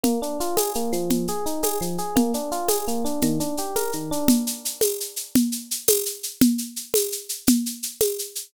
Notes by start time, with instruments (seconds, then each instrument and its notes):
0.03 electric piano 1 A#3, low conga, shaker
0.22 electric piano 1 D4, shaker
0.40 electric piano 1 F4, shaker
0.57 electric piano 1 G#4, tambourine, high conga, shaker
0.75 electric piano 1 A#3, shaker
0.93 electric piano 1 F3, shaker
1.10 low conga, shaker
1.28 electric piano 1 G#4, shaker
1.46 electric piano 1 D#4, shaker
1.63 electric piano 1 G#4, tambourine, high conga, shaker
1.81 electric piano 1 F3, shaker
1.98 electric piano 1 G#4, shaker
2.16 electric piano 1 A#3, low conga, shaker
2.34 electric piano 1 D4, shaker
2.52 electric piano 1 F4, shaker
2.68 electric piano 1 G#4, tambourine, high conga, shaker
2.88 electric piano 1 A#3, shaker
3.05 electric piano 1 D4, shaker
3.21 electric piano 1 D#3, low conga, shaker
3.40 electric piano 1 D4, shaker
3.57 electric piano 1 G4, shaker
3.76 electric piano 1 A#4, tambourine, high conga, shaker
3.92 electric piano 1 D#3, shaker
4.11 electric piano 1 D4, shaker
4.28 low conga, shaker
4.47 shaker
4.65 shaker
4.81 tambourine, high conga, shaker
5.00 shaker
5.16 shaker
5.35 low conga, shaker
5.52 shaker
5.71 shaker
5.88 tambourine, high conga, shaker
6.06 shaker
6.23 shaker
6.41 low conga, shaker
6.58 shaker
6.76 shaker
6.94 tambourine, high conga, shaker
7.12 shaker
7.29 shaker
7.47 low conga, shaker
7.66 shaker
7.83 shaker
8.01 tambourine, high conga, shaker
8.19 shaker
8.35 shaker